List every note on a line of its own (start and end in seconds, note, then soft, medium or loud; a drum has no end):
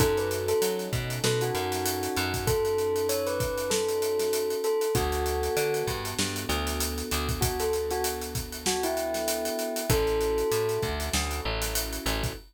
0.00 0.54 F#2 medium
0.00 4.86 C#4 medium
0.00 4.86 D#4 medium
0.00 4.86 F#4 medium
0.00 0.15 A4 medium
0.00 4.86 A4 medium
0.00 kick medium
0.00 closed hi-hat medium
0.17 0.31 B4 medium
0.17 closed hi-hat medium
0.31 closed hi-hat medium
0.48 0.61 A4 medium
0.48 closed hi-hat medium
0.62 0.89 F#3 medium
0.62 closed hi-hat loud
0.79 closed hi-hat medium
0.93 1.19 B2 medium
0.93 kick medium
0.93 closed hi-hat medium
1.10 closed hi-hat medium
1.24 1.51 B2 medium
1.24 1.40 A4 medium
1.24 snare loud
1.41 2.41 F#4 medium
1.41 closed hi-hat medium
1.55 2.08 F#2 medium
1.55 closed hi-hat medium
1.72 snare medium
1.72 closed hi-hat medium
1.86 closed hi-hat loud
2.03 closed hi-hat medium
2.16 4.55 F#2 medium
2.16 closed hi-hat medium
2.34 kick medium
2.34 closed hi-hat medium
2.47 3.05 A4 medium
2.47 kick medium
2.47 closed hi-hat medium
2.65 closed hi-hat medium
2.78 closed hi-hat medium
2.96 closed hi-hat medium
3.09 3.26 C#5 medium
3.09 closed hi-hat medium
3.27 3.66 B4 medium
3.27 closed hi-hat medium
3.40 kick medium
3.40 closed hi-hat medium
3.58 closed hi-hat medium
3.70 4.54 A4 medium
3.70 snare loud
3.89 closed hi-hat medium
4.02 closed hi-hat medium
4.19 snare medium
4.19 closed hi-hat medium
4.33 closed hi-hat medium
4.50 closed hi-hat medium
4.64 4.90 A4 medium
4.64 closed hi-hat medium
4.81 closed hi-hat medium
4.95 5.49 D2 medium
4.95 9.81 B3 medium
4.95 9.81 D4 medium
4.95 9.81 F#4 medium
4.95 5.85 F#4 medium
4.95 9.81 A4 medium
4.95 kick loud
4.95 closed hi-hat medium
5.12 closed hi-hat medium
5.26 closed hi-hat medium
5.43 closed hi-hat medium
5.57 5.84 D3 medium
5.57 closed hi-hat medium
5.74 closed hi-hat medium
5.87 6.14 G2 medium
5.87 kick medium
5.87 closed hi-hat medium
6.05 closed hi-hat medium
6.19 6.46 G2 medium
6.19 snare medium
6.36 closed hi-hat medium
6.49 7.03 D2 medium
6.49 closed hi-hat medium
6.67 snare soft
6.67 closed hi-hat medium
6.80 closed hi-hat medium
6.98 closed hi-hat medium
7.11 9.50 D2 medium
7.11 closed hi-hat medium
7.29 kick medium
7.29 closed hi-hat medium
7.41 7.57 F#4 medium
7.41 kick medium
7.41 closed hi-hat loud
7.60 7.73 A4 medium
7.60 closed hi-hat medium
7.73 closed hi-hat medium
7.91 8.04 F#4 medium
7.91 closed hi-hat medium
8.04 closed hi-hat medium
8.22 closed hi-hat medium
8.35 kick medium
8.35 closed hi-hat medium
8.52 closed hi-hat medium
8.66 8.83 F#4 medium
8.66 snare loud
8.83 9.86 E4 medium
8.83 closed hi-hat medium
8.97 closed hi-hat medium
9.14 snare medium
9.14 closed hi-hat medium
9.28 closed hi-hat medium
9.45 closed hi-hat medium
9.59 closed hi-hat medium
9.76 closed hi-hat medium
9.90 10.43 A1 medium
9.90 12.33 C#4 medium
9.90 12.33 E4 medium
9.90 12.33 F#4 medium
9.90 12.33 A4 medium
9.90 10.79 A4 medium
9.90 kick loud
9.90 closed hi-hat medium
10.07 closed hi-hat medium
10.21 closed hi-hat medium
10.38 closed hi-hat medium
10.51 10.78 A2 medium
10.51 closed hi-hat medium
10.69 closed hi-hat medium
10.82 11.10 D2 medium
10.82 kick medium
10.82 closed hi-hat medium
11.00 closed hi-hat medium
11.13 11.41 D2 medium
11.13 snare loud
11.31 closed hi-hat medium
11.45 11.99 A1 medium
11.62 snare medium
11.62 closed hi-hat medium
11.75 closed hi-hat loud
11.93 closed hi-hat medium
12.06 12.33 A1 medium
12.06 closed hi-hat medium
12.24 kick medium
12.24 closed hi-hat medium